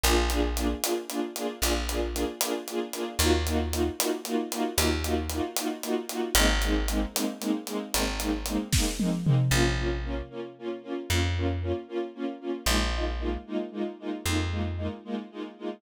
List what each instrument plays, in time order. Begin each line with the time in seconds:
0.04 electric bass (finger) A#1, string ensemble 1 A#3 D4 F4 G#4, closed hi-hat
0.30 string ensemble 1 A#3 D4 F4 G#4, closed hi-hat
0.57 string ensemble 1 A#3 D4 F4 G#4, closed hi-hat
0.83 string ensemble 1 A#3 D4 F4 G#4, closed hi-hat
1.09 string ensemble 1 A#3 D4 F4 G#4, closed hi-hat
1.36 string ensemble 1 A#3 D4 F4 G#4, closed hi-hat
1.62 electric bass (finger) A#1, string ensemble 1 A#3 D4 F4 G#4, closed hi-hat
1.89 string ensemble 1 A#3 D4 F4 G#4, closed hi-hat
2.13 string ensemble 1 A#3 D4 F4 G#4, closed hi-hat
2.41 string ensemble 1 A#3 D4 F4 G#4, closed hi-hat
2.68 string ensemble 1 A#3 D4 F4 G#4, closed hi-hat
2.93 string ensemble 1 A#3 D4 F4 G#4, closed hi-hat
3.19 electric bass (finger) D#2, string ensemble 1 A#3 D#4 F4 F#4, closed hi-hat
3.47 string ensemble 1 A#3 D#4 F4 F#4, closed hi-hat
3.72 string ensemble 1 A#3 D#4 F4 F#4, closed hi-hat
3.99 string ensemble 1 A#3 D#4 F4 F#4, closed hi-hat
4.25 string ensemble 1 A#3 D#4 F4 F#4, closed hi-hat
4.52 string ensemble 1 A#3 D#4 F4 F#4, closed hi-hat
4.77 electric bass (finger) D#2, string ensemble 1 A#3 D#4 F4 F#4, closed hi-hat
5.04 string ensemble 1 A#3 D#4 F4 F#4, closed hi-hat
5.29 string ensemble 1 A#3 D#4 F4 F#4, closed hi-hat
5.56 string ensemble 1 A#3 D#4 F4 F#4, closed hi-hat
5.83 string ensemble 1 A#3 D#4 F4 F#4, closed hi-hat
6.09 string ensemble 1 A#3 D#4 F4 F#4, closed hi-hat
6.35 electric bass (finger) G#1, string ensemble 1 G#3 A#3 C4 D#4, closed hi-hat
6.62 string ensemble 1 G#3 A#3 C4 D#4, closed hi-hat
6.88 string ensemble 1 G#3 A#3 C4 D#4, closed hi-hat
7.14 string ensemble 1 G#3 A#3 C4 D#4, closed hi-hat
7.40 string ensemble 1 G#3 A#3 C4 D#4, closed hi-hat
7.66 string ensemble 1 G#3 A#3 C4 D#4, closed hi-hat
7.93 electric bass (finger) G#1, string ensemble 1 G#3 A#3 C4 D#4, closed hi-hat
8.20 string ensemble 1 G#3 A#3 C4 D#4, closed hi-hat
8.46 string ensemble 1 G#3 A#3 C4 D#4, closed hi-hat
8.72 string ensemble 1 G#3 A#3 C4 D#4, kick, snare
8.99 string ensemble 1 G#3 A#3 C4 D#4, high tom
9.24 string ensemble 1 G#3 A#3 C4 D#4, mid tom
9.51 electric bass (finger) A#1, string ensemble 1 A#3 C#4 F4
9.78 string ensemble 1 A#3 C#4 F4
10.04 string ensemble 1 A#3 C#4 F4
10.30 string ensemble 1 A#3 C#4 F4
10.58 string ensemble 1 A#3 C#4 F4
10.83 string ensemble 1 A#3 C#4 F4
11.09 electric bass (finger) F2, string ensemble 1 A#3 C#4 F4
11.36 string ensemble 1 A#3 C#4 F4
11.61 string ensemble 1 A#3 C#4 F4
11.88 string ensemble 1 A#3 C#4 F4
12.15 string ensemble 1 A#3 C#4 F4
12.40 string ensemble 1 A#3 C#4 F4
12.66 electric bass (finger) A#1, string ensemble 1 G#3 A#3 D#4 F4
12.93 string ensemble 1 G#3 A#3 D#4 F4
13.19 string ensemble 1 G#3 A#3 D#4 F4
13.46 string ensemble 1 G#3 A#3 D#4 F4
13.72 string ensemble 1 G#3 A#3 D#4 F4
13.99 string ensemble 1 G#3 A#3 D#4 F4
14.26 electric bass (finger) F2, string ensemble 1 G#3 A#3 D#4 F4
14.51 string ensemble 1 G#3 A#3 D#4 F4
14.77 string ensemble 1 G#3 A#3 D#4 F4
15.04 string ensemble 1 G#3 A#3 D#4 F4
15.31 string ensemble 1 G#3 A#3 D#4 F4
15.58 string ensemble 1 G#3 A#3 D#4 F4